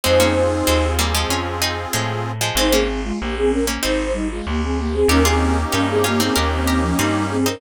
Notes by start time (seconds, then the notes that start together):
0.03 F2 G#3 C4 D#4 F4 G#4 C5
0.20 A#3 C#4
0.67 D#2 G#3 C4
0.99 G3 A#3
1.14 F3 G#3
1.29 F2 C#4 F4
1.62 C4 D#4
1.93 A2 F3 G#3
2.41 F3 G#3
2.55 G#1 G#3 C4 D#4 C5
2.71 A#3 C4 C#4 G#4
3.04 G#3 F4
3.20 A#1 A#3 G4
3.36 C4 G#4
3.50 C#4 A#4
3.67 A#3 C#4
3.83 G#1 C4 D#4 C5
4.13 G3 D#4
4.31 G#3 F4
4.47 D2 A#3 G4
4.63 C4 G#4
4.79 A#3 G4
4.92 C4 G#4
5.08 D#2 A#3 C#4 D#4 G4 A#4
5.25 C4 F4 G#4
5.71 G2 C#4 D#4 G4 A#4
5.90 C4 G#4
6.04 A#3 C#4 F4 G4
6.20 C4 D#4 G#4
6.35 D#2 C#4 G4 A#4
6.50 D#3 C4
6.67 G4 A#4
6.81 F3 C#4
6.98 G2 G3 C4 D#4
7.30 C4 G#4
7.46 C4 C#4 D#4 A#4